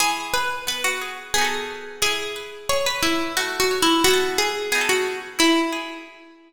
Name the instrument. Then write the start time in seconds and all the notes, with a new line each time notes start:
pizzicato strings
0.00 E3 G#4
0.34 G#4 B4
0.67 B3 B4
0.84 F#4
1.01 G#4
1.34 B3 G#4
1.38 D#4 F#4
1.45 A4
2.02 E4 G#4
2.36 B4
2.69 G#4 C#5
2.86 B4
3.03 E4 B4
3.37 A3 F#4
3.60 F#4
3.71 C#5
3.82 E4
4.04 B3 E4 F#4
4.11 F#4 A4
4.38 G#4
4.72 B3 D#4 G#4
4.78 F#4 A4
4.89 F#4
5.39 E4
5.72 G#4